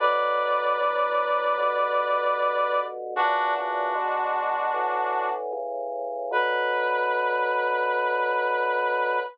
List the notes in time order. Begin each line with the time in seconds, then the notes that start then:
0.00 B2 D3 F#3 B4 D5
0.79 D2 A2 F#3
1.58 G2 B2 D3
3.16 F#2 A#2 C#3 E3 D4 F#4
3.55 D4 F#4
3.95 E2 B2 G#3
4.74 A2 D3 E3
5.53 A2 C#3 E3
6.31 B2 D3 F#3 B4